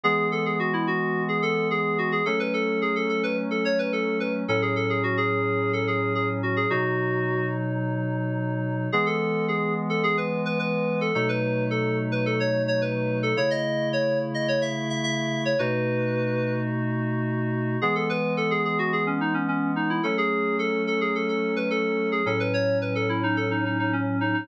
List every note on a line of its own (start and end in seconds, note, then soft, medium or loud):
0.04 2.21 E3 medium
0.04 2.21 G#3 medium
0.04 2.21 B3 medium
0.04 0.28 G#4 loud
0.32 0.45 A4 medium
0.46 0.59 G#4 medium
0.59 0.73 F#4 medium
0.73 0.87 E4 medium
0.87 1.23 F#4 medium
1.29 1.42 G#4 medium
1.42 1.68 A4 loud
1.71 1.98 G#4 medium
1.98 2.11 F#4 medium
2.12 2.25 G#4 medium
2.26 4.44 F#3 medium
2.26 4.44 A3 medium
2.26 4.44 C#4 medium
2.26 2.39 A4 loud
2.40 2.53 B4 medium
2.54 2.80 A4 medium
2.82 2.95 G#4 medium
2.96 3.09 A4 medium
3.09 3.22 A4 medium
3.23 3.37 B4 medium
3.51 3.64 A4 medium
3.65 3.78 C#5 medium
3.79 3.92 B4 medium
3.93 4.18 A4 medium
4.20 4.33 B4 medium
4.48 6.66 A2 medium
4.48 6.66 F#3 medium
4.48 6.66 C#4 medium
4.48 4.62 A4 medium
4.62 4.75 G#4 medium
4.76 4.89 A4 medium
4.90 5.03 G#4 medium
5.03 5.17 F#4 medium
5.17 5.72 G#4 medium
5.73 5.86 A4 medium
5.87 6.13 G#4 medium
6.15 6.28 G#4 medium
6.43 6.56 F#4 medium
6.57 6.70 G#4 medium
6.70 8.88 B2 medium
6.70 8.88 F#3 medium
6.70 8.88 D#4 medium
6.70 7.46 F#4 medium
8.92 11.11 E3 medium
8.92 11.11 G#3 medium
8.92 11.11 B3 medium
8.92 9.06 G#4 loud
9.06 9.45 A4 medium
9.48 9.74 G#4 medium
9.90 10.03 A4 medium
10.03 10.17 G#4 loud
10.17 10.41 B4 medium
10.45 10.59 B4 medium
10.59 10.99 B4 medium
11.01 11.14 A4 medium
11.15 13.33 B2 medium
11.15 13.33 F#3 medium
11.15 13.33 A3 medium
11.15 13.33 D#4 medium
11.15 11.28 A4 medium
11.29 11.64 B4 medium
11.71 11.98 A4 medium
12.12 12.25 B4 medium
12.26 12.39 A4 medium
12.40 12.62 C#5 medium
12.68 12.81 C#5 medium
12.82 13.18 B4 medium
13.23 13.36 A4 medium
13.37 15.54 C#3 medium
13.37 15.54 A3 medium
13.37 15.54 E4 medium
13.37 13.50 C#5 medium
13.51 13.88 D#5 medium
13.93 14.19 C#5 medium
14.34 14.48 D#5 medium
14.48 14.61 C#5 medium
14.62 14.89 E5 medium
14.90 15.03 E5 medium
15.04 15.43 E5 medium
15.45 15.59 C#5 medium
15.59 17.77 B2 medium
15.59 17.77 A3 medium
15.59 17.77 D#4 medium
15.59 17.77 F#4 medium
15.59 16.53 B4 medium
17.82 20.00 E3 medium
17.82 20.00 G#3 medium
17.82 20.00 B3 medium
17.82 17.95 G#4 medium
17.95 18.09 A4 medium
18.10 18.33 B4 loud
18.37 18.50 A4 medium
18.51 18.64 G#4 medium
18.65 18.78 G#4 medium
18.79 18.92 F#4 medium
18.93 19.06 G#4 medium
19.07 19.20 C#4 medium
19.21 19.34 D#4 medium
19.34 19.47 C#4 medium
19.48 19.72 C#4 medium
19.76 19.89 D#4 medium
19.90 20.03 E4 medium
20.03 22.22 F#3 medium
20.03 22.22 A3 medium
20.03 22.22 C#4 medium
20.03 20.17 A4 medium
20.18 20.56 G#4 medium
20.59 20.83 A4 medium
20.87 21.00 A4 medium
21.01 21.14 G#4 medium
21.15 21.28 A4 medium
21.29 21.54 A4 medium
21.56 21.69 B4 medium
21.70 22.09 A4 medium
22.12 22.25 G#4 medium
22.26 24.43 A2 medium
22.26 24.43 F#3 medium
22.26 24.43 C#4 medium
22.26 22.39 A4 medium
22.40 22.53 B4 medium
22.54 22.78 C#5 medium
22.82 22.95 B4 medium
22.95 23.08 A4 medium
23.09 23.22 E4 medium
23.23 23.36 D#4 medium
23.37 23.50 A4 medium
23.51 23.64 D#4 medium
23.65 23.78 D#4 medium
23.79 23.92 D#4 medium
23.93 24.20 C#4 medium
24.21 24.33 D#4 medium
24.34 24.47 D#4 medium